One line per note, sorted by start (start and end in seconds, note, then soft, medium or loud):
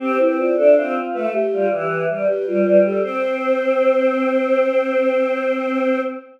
0.00 0.18 C4 loud
0.00 0.18 G4 medium
0.19 0.50 C4 medium
0.19 0.37 E4 medium
0.19 0.37 B4 medium
0.38 0.56 F4 medium
0.38 0.56 D5 medium
0.56 0.74 D4 loud
0.56 0.75 A4 medium
0.56 0.75 E5 medium
0.76 0.96 C4 loud
0.76 1.27 F4 medium
0.76 0.94 C5 medium
1.14 1.32 A3 loud
1.14 1.32 B4 medium
1.33 1.67 G4 medium
1.52 1.71 G3 loud
1.52 1.70 F4 medium
1.70 2.04 E3 loud
1.70 2.05 G4 medium
2.08 2.26 G3 loud
2.08 2.26 B4 medium
2.28 2.46 G4 medium
2.28 2.80 B4 medium
2.47 2.64 G3 loud
2.47 2.81 F4 medium
2.65 2.98 G3 loud
2.85 3.03 G4 medium
2.85 3.03 A4 medium
3.02 5.99 C4 loud
3.02 6.01 C5 loud